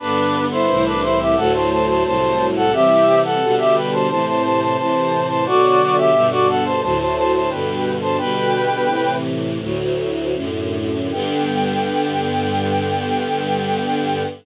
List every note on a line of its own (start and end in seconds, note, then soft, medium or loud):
0.00 0.67 G2 medium
0.00 0.67 D3 medium
0.00 0.67 B3 medium
0.00 0.43 D4 medium
0.00 0.43 B4 medium
0.51 0.84 E4 medium
0.51 0.84 C5 medium
0.68 1.36 C2 medium
0.68 1.36 A2 medium
0.68 1.36 E3 medium
0.85 1.01 D4 medium
0.85 1.01 B4 medium
1.02 1.19 E4 medium
1.02 1.19 C5 medium
1.19 1.36 G4 medium
1.19 1.36 E5 medium
1.36 2.04 D2 medium
1.36 2.04 A2 medium
1.36 2.04 F#3 medium
1.36 1.53 A4 medium
1.36 1.53 F#5 medium
1.54 1.70 C5 medium
1.54 1.70 A5 medium
1.70 1.87 C5 medium
1.70 1.87 A5 medium
1.87 2.03 C5 medium
1.87 2.03 A5 medium
2.05 2.72 C2 medium
2.05 2.72 A2 medium
2.05 2.72 F#3 medium
2.05 2.47 C5 medium
2.05 2.47 A5 medium
2.56 2.72 A4 medium
2.56 2.72 F#5 medium
2.72 3.40 C3 medium
2.72 3.40 E3 medium
2.72 3.40 G3 medium
2.72 3.20 G4 medium
2.72 3.20 E5 medium
3.24 3.55 A4 medium
3.24 3.55 F#5 medium
3.41 4.08 B2 medium
3.41 4.08 D3 medium
3.41 4.08 G3 medium
3.58 3.74 G4 medium
3.58 3.74 E5 medium
3.75 3.91 B4 medium
3.75 3.91 G5 medium
3.92 4.08 C5 medium
3.92 4.08 A5 medium
4.09 4.77 A2 medium
4.09 4.77 C3 medium
4.09 4.77 E3 medium
4.09 4.25 C5 medium
4.09 4.25 A5 medium
4.26 4.42 C5 medium
4.26 4.42 A5 medium
4.43 4.60 C5 medium
4.43 4.60 A5 medium
4.61 4.77 C5 medium
4.61 4.77 A5 medium
4.77 5.45 A2 medium
4.77 5.45 C3 medium
4.77 5.45 E3 medium
4.77 5.26 C5 medium
4.77 5.26 A5 medium
5.28 5.44 C5 medium
5.28 5.44 A5 medium
5.45 6.13 B2 medium
5.45 6.13 D3 medium
5.45 6.13 F#3 medium
5.45 5.95 F#4 medium
5.45 5.95 D5 loud
5.97 6.27 G4 medium
5.97 6.27 E5 medium
6.13 6.81 G2 medium
6.13 6.81 B2 medium
6.13 6.81 D3 medium
6.30 6.46 F#4 medium
6.30 6.46 D5 medium
6.48 6.64 A4 medium
6.48 6.64 F#5 medium
6.64 6.81 C5 medium
6.64 6.81 A5 medium
6.82 7.50 D2 medium
6.82 7.50 A2 medium
6.82 7.50 F#3 medium
6.82 6.98 C5 medium
6.82 6.98 A5 medium
6.99 7.15 C5 medium
6.99 7.15 A5 medium
7.16 7.32 C5 medium
7.16 7.32 A5 medium
7.33 7.49 C5 medium
7.33 7.49 A5 medium
7.50 8.17 G2 medium
7.50 8.17 B2 medium
7.50 8.17 D3 medium
7.50 7.92 B4 medium
7.50 7.92 G5 medium
8.01 8.17 C5 medium
8.01 8.17 A5 medium
8.18 8.87 B2 medium
8.18 8.87 D3 medium
8.18 8.87 G3 medium
8.18 9.14 B4 loud
8.18 9.14 G5 loud
8.88 9.59 A2 medium
8.88 9.59 C3 medium
8.88 9.59 E3 medium
9.60 10.34 D2 medium
9.60 10.34 A2 medium
9.60 10.34 F#3 medium
10.34 11.11 F#2 medium
10.34 11.11 A2 medium
10.34 11.11 D3 medium
11.12 14.23 G2 loud
11.12 14.23 D3 loud
11.12 14.23 B3 medium
11.12 14.24 G5 loud